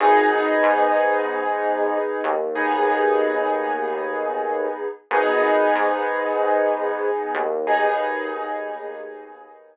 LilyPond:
<<
  \new Staff \with { instrumentName = "Acoustic Grand Piano" } { \time 4/4 \key gis \minor \tempo 4 = 94 <b dis' gis'>1 | <b dis' gis'>1 | <b dis' gis'>1 | <b dis' gis'>1 | }
  \new Staff \with { instrumentName = "Synth Bass 1" } { \clef bass \time 4/4 \key gis \minor gis,,4 gis,2~ gis,8 dis,8~ | dis,1 | gis,,4 gis,2~ gis,8 dis,8~ | dis,1 | }
>>